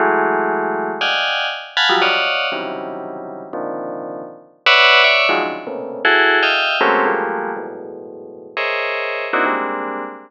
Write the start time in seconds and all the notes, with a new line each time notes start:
0.00 E3 F#3 G#3 A3
1.01 D5 D#5 F5 F#5 G5 G#5
1.77 F5 F#5 G#5 A5 B5
1.89 F3 F#3 G3
2.02 C#5 D5 D#5 F5 F#5
2.52 C3 C#3 D#3 E3 F#3 G3
3.53 A#2 C3 D3 D#3 F3
4.66 B4 C#5 D5 E5 F#5
5.04 C#5 D5 E5
5.29 D#3 F3 F#3 G#3
5.42 C#3 D3 D#3 F3
5.67 A2 A#2 B2 C3 C#3
6.05 E4 F#4 G#4 A4
6.43 D#5 E5 F5 G5
6.81 F#3 G#3 A3 A#3 C4 C#4
7.06 F3 G3 G#3 A3 A#3
7.57 E2 F#2 G#2 A2 B2
8.57 G#4 A#4 C5 C#5 D#5 E5
9.33 A#3 C4 D4 D#4 E4 F#4
9.46 G3 G#3 A#3 C4 D4